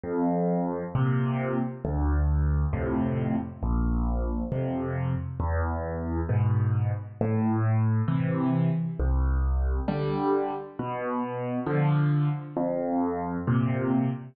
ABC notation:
X:1
M:4/4
L:1/8
Q:1/4=67
K:Am
V:1 name="Acoustic Grand Piano" clef=bass
F,,2 [_B,,C,]2 D,,2 [F,,A,,C,]2 | _B,,,2 [F,,C,]2 E,,2 [^G,,=B,,]2 | A,,2 [C,E,]2 C,,2 [D,G,]2 | B,,2 [D,F,]2 F,,2 [_B,,C,]2 |]